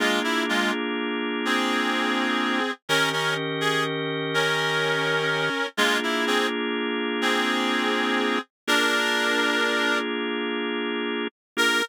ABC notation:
X:1
M:12/8
L:1/8
Q:3/8=83
K:Bb
V:1 name="Clarinet"
[_A,F] =E [A,F] z3 [C_A]6 | [_DB] [DB] z _A z2 [DB]6 | [_A,F] =E [C_A] z3 [CA]6 | [DB]6 z6 |
B3 z9 |]
V:2 name="Drawbar Organ"
[B,DF_A]12 | [E,_DGB]12 | [B,DF_A]12 | [B,DF_A]12 |
[B,DF_A]3 z9 |]